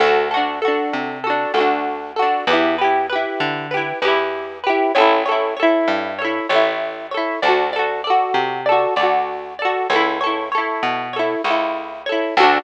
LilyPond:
<<
  \new Staff \with { instrumentName = "Acoustic Guitar (steel)" } { \time 4/4 \key d \major \tempo 4 = 97 <d' fis' a'>8 <d' fis' a'>8 <d' fis' a'>4 <d' fis' a'>8 <d' fis' a'>4 <d' fis' a'>8 | <e' g' b'>8 <e' g' b'>8 <e' g' b'>4 <e' g' b'>8 <e' g' b'>4 <e' g' b'>8 | <e' a' cis''>8 <e' a' cis''>8 <e' a' cis''>4 <e' a' cis''>8 <e' a' cis''>4 <e' a' cis''>8 | <fis' a' d''>8 <fis' a' d''>8 <fis' a' d''>4 <fis' a' d''>8 <fis' a' d''>4 <fis' a' d''>8 |
<e' a' cis''>8 <e' a' cis''>8 <e' a' cis''>4 <e' a' cis''>8 <e' a' cis''>4 <e' a' cis''>8 | <d' fis' a'>4 r2. | }
  \new Staff \with { instrumentName = "Electric Bass (finger)" } { \clef bass \time 4/4 \key d \major d,4. c4 d,4. | e,4. d4 e,4. | a,,4. g,4 a,,4. | d,4. c4 d,4. |
cis,4. b,4 cis,4. | d,4 r2. | }
>>